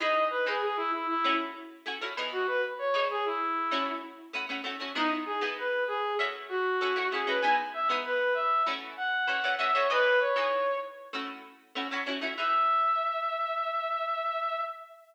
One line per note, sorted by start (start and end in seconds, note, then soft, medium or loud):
0.00 0.37 E3 loud
0.00 0.37 D#4 loud
0.00 0.37 G#4 loud
0.00 0.37 B4 loud
0.00 0.24 D#5 loud
0.30 0.45 B4 medium
0.46 0.96 E3 medium
0.46 0.96 D#4 loud
0.46 0.62 G#4 medium
0.46 0.96 G#4 medium
0.46 0.96 B4 medium
0.62 0.77 G#4 medium
0.77 0.91 E4 loud
0.92 1.07 E4 medium
1.09 1.34 E4 loud
1.24 1.74 A3 loud
1.24 1.74 C#4 loud
1.24 1.74 E4 loud
1.24 1.74 F#4 loud
1.86 1.98 A3 loud
1.86 1.98 C#4 medium
1.86 1.98 E4 loud
1.86 1.98 F#4 loud
2.01 2.14 A3 loud
2.01 2.14 C#4 loud
2.01 2.14 E4 loud
2.01 2.14 F#4 loud
2.17 2.85 E3 loud
2.17 2.85 B3 loud
2.17 2.85 D#4 loud
2.17 2.85 G#4 loud
2.32 2.47 F#4 loud
2.47 2.62 B4 loud
2.79 3.05 C#5 loud
2.94 3.43 E3 medium
2.94 3.43 B3 medium
2.94 3.43 D#4 loud
2.94 3.43 G#4 loud
3.10 3.25 G#4 loud
3.25 3.91 E4 medium
3.71 4.21 A3 loud
3.71 4.21 C#4 loud
3.71 4.21 E4 loud
3.71 4.21 F#4 loud
4.33 4.45 A3 loud
4.33 4.45 C#4 loud
4.33 4.45 E4 loud
4.33 4.45 F#4 loud
4.49 4.61 A3 medium
4.49 4.61 C#4 loud
4.49 4.61 E4 medium
4.49 4.61 F#4 medium
4.64 4.76 A3 loud
4.64 4.76 C#4 medium
4.64 4.76 E4 medium
4.64 4.76 F#4 loud
4.80 4.92 A3 medium
4.80 4.92 C#4 loud
4.80 4.92 E4 loud
4.80 4.92 F#4 medium
4.95 5.32 G#3 loud
4.95 5.32 B3 loud
4.95 5.10 D#4 loud
4.95 5.32 D#4 loud
4.95 5.32 E4 loud
5.26 5.40 G#4 medium
5.41 5.90 G#3 loud
5.41 5.90 B3 loud
5.41 5.90 D#4 loud
5.41 5.90 E4 loud
5.58 5.84 B4 medium
5.87 6.14 G#4 loud
6.19 6.68 A3 loud
6.19 6.68 C#4 loud
6.19 6.68 E4 loud
6.19 6.68 F#4 loud
6.49 7.09 F#4 loud
6.81 6.93 A3 loud
6.81 6.93 C#4 medium
6.81 6.93 E4 medium
6.81 6.93 F#4 loud
6.96 7.08 A3 loud
6.96 7.08 C#4 medium
6.96 7.08 E4 medium
6.96 7.08 F#4 loud
7.12 7.24 A3 loud
7.12 7.24 C#4 medium
7.12 7.24 E4 medium
7.12 7.24 F#4 loud
7.12 7.26 G#4 medium
7.27 7.39 A3 loud
7.27 7.39 C#4 medium
7.27 7.39 E4 loud
7.27 7.39 F#4 loud
7.27 7.42 B4 medium
7.41 7.79 G#3 loud
7.41 7.79 B3 loud
7.41 7.79 D#4 loud
7.41 7.79 E4 loud
7.41 7.55 G#5 loud
7.74 7.88 E5 loud
7.89 8.38 G#3 medium
7.89 8.38 B3 loud
7.89 8.38 D#4 loud
7.89 8.38 E4 loud
8.05 8.34 B4 loud
8.34 8.63 E5 medium
8.66 9.16 E3 loud
8.66 9.16 A3 loud
8.66 9.16 C#4 loud
8.66 9.16 F#4 loud
8.97 9.55 F#5 loud
9.27 9.40 E3 medium
9.27 9.40 A3 medium
9.27 9.40 C#4 loud
9.27 9.40 F#4 medium
9.43 9.56 E3 loud
9.43 9.56 A3 loud
9.43 9.56 C#4 loud
9.43 9.56 F#4 medium
9.59 9.71 E3 loud
9.59 9.71 A3 loud
9.59 9.71 C#4 loud
9.59 9.71 F#4 loud
9.59 9.73 E5 loud
9.73 9.87 E3 medium
9.73 9.87 A3 loud
9.73 9.87 C#4 loud
9.73 9.87 F#4 loud
9.73 9.88 C#5 loud
9.90 10.27 E3 loud
9.90 10.27 B3 loud
9.90 10.27 D#4 loud
9.90 10.27 G#4 loud
9.90 10.19 B4 loud
10.20 10.77 C#5 medium
10.36 10.85 E3 loud
10.36 10.85 B3 loud
10.36 10.85 D#4 medium
10.36 10.85 G#4 medium
11.13 11.62 A3 loud
11.13 11.62 C#4 loud
11.13 11.62 E4 loud
11.13 11.62 F#4 loud
11.75 11.88 A3 loud
11.75 11.88 C#4 loud
11.75 11.88 E4 medium
11.75 11.88 F#4 medium
11.91 12.03 A3 loud
11.91 12.03 C#4 medium
11.91 12.03 E4 loud
11.91 12.03 F#4 loud
12.06 12.19 A3 loud
12.06 12.19 C#4 loud
12.06 12.19 E4 medium
12.06 12.19 F#4 loud
12.21 12.34 A3 loud
12.21 12.34 C#4 loud
12.21 12.34 E4 loud
12.21 12.34 F#4 loud
12.37 14.61 E3 medium
12.37 14.61 D#4 medium
12.37 14.61 G#4 medium
12.37 14.61 B4 loud
12.37 14.61 E5 loud